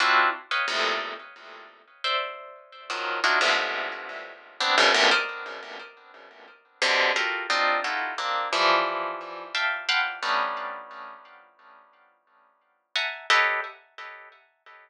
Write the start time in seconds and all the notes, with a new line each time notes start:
0.00 C4 D4 E4 F4 F#4
0.51 B4 C#5 D#5 F5 G5
0.68 E2 F2 G2 A2 A#2 C3
2.04 C5 D5 E5
2.90 D#3 F3 F#3
3.24 D4 D#4 E4 F4 F#4
3.41 F2 G2 G#2 A2 B2 C3
4.60 B3 C4 D4
4.78 F#2 G2 G#2 A#2 B2 C#3
4.94 G2 A2 A#2 B2 C3 C#3
5.11 A#4 C5 D5 D#5
6.82 B2 C3 D3
7.16 F4 F#4 G4 A4 A#4
7.50 C4 D4 D#4 F4
7.84 D#4 E4 F4 F#4 G4 A4
8.18 A#3 C4 D4
8.53 E3 F3 G3
9.55 E5 F5 G5 A5
9.89 F5 F#5 G5 A5 B5 C6
10.23 G3 A3 B3 C#4 D4 D#4
12.96 E5 F#5 G#5 A5 A#5
13.30 G4 A4 B4 C#5 D#5